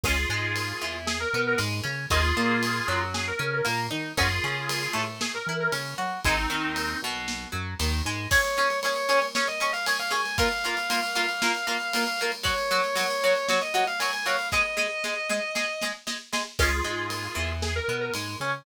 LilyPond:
<<
  \new Staff \with { instrumentName = "Lead 1 (square)" } { \time 4/4 \key des \major \tempo 4 = 116 <f' aes'>2 aes'16 bes'8 bes'16 r4 | <f' aes'>2 aes'16 bes'8 bes'16 r4 | <f' aes'>2 aes'16 bes'8 bes'16 r4 | <c' ees'>4. r2 r8 |
r1 | r1 | r1 | r1 |
<f' aes'>2 aes'16 bes'8 bes'16 r4 | }
  \new Staff \with { instrumentName = "Distortion Guitar" } { \time 4/4 \key des \major r1 | r1 | r1 | r1 |
des''4 des''4 des''16 ees''8 f''16 aes''16 f''16 aes''8 | f''1 | des''4 des''4 des''16 ees''8 f''16 aes''16 aes''16 f''8 | ees''2. r4 |
r1 | }
  \new Staff \with { instrumentName = "Acoustic Guitar (steel)" } { \time 4/4 \key des \major <aes des'>8 aes4 e4 b8 aes8 des'8 | <bes ees'>8 bes4 ges4 des'8 bes8 ees'8 | <des' ges'>8 des'4 a4 e'8 des'8 ges'8 | <aes ees'>8 ees4 b,4 ges8 ees8 aes8 |
<des' aes' des''>8 <des' aes' des''>8 <des' aes' des''>8 <des' aes' des''>8 <des' aes' des''>8 <des' aes' des''>8 <des' aes' des''>8 <des' aes' des''>8 | <bes f' bes'>8 <bes f' bes'>8 <bes f' bes'>8 <bes f' bes'>8 <bes f' bes'>8 <bes f' bes'>8 <bes f' bes'>8 <bes f' bes'>8 | <ges ges' des''>8 <ges ges' des''>8 <ges ges' des''>8 <ges ges' des''>8 <ges ges' des''>8 <ges ges' des''>8 <ges ges' des''>8 <ges ges' des''>8 | <aes aes' ees''>8 <aes aes' ees''>8 <aes aes' ees''>8 <aes aes' ees''>8 <aes aes' ees''>8 <aes aes' ees''>8 <aes aes' ees''>8 <aes aes' ees''>8 |
<aes des'>8 aes4 e4 b8 aes8 des'8 | }
  \new Staff \with { instrumentName = "Synth Bass 1" } { \clef bass \time 4/4 \key des \major des,8 aes,4 e,4 b,8 aes,8 des8 | ees,8 bes,4 ges,4 des8 bes,8 ees8 | ges,8 des4 a,4 e8 des8 ges8 | aes,,8 ees,4 b,,4 ges,8 ees,8 aes,8 |
r1 | r1 | r1 | r1 |
des,8 aes,4 e,4 b,8 aes,8 des8 | }
  \new DrumStaff \with { instrumentName = "Drums" } \drummode { \time 4/4 <cymc bd>4 cymr4 sn4 cymr4 | <bd cymr>4 cymr4 sn4 cymr4 | <bd cymr>4 cymr4 sn4 cymr4 | <bd cymr>4 cymr4 sn4 cymr4 |
<cymc bd>16 cymr16 cymr16 cymr16 cymr16 cymr16 cymr16 cymr16 sn16 cymr16 cymr16 cymr16 cymr16 cymr16 cymr16 cymr16 | <bd cymr>16 cymr16 cymr16 cymr16 cymr16 cymr16 cymr16 cymr16 sn16 cymr16 cymr16 cymr16 cymr16 cymr16 cymr16 cymr16 | <bd cymr>16 cymr16 cymr16 cymr16 cymr16 cymr16 cymr16 cymr16 sn16 cymr16 cymr16 cymr16 cymr16 cymr16 cymr16 cymr16 | <bd sn>8 sn8 sn8 sn8 sn8 sn8 sn8 sn8 |
<cymc bd>4 cymr4 sn4 cymr4 | }
>>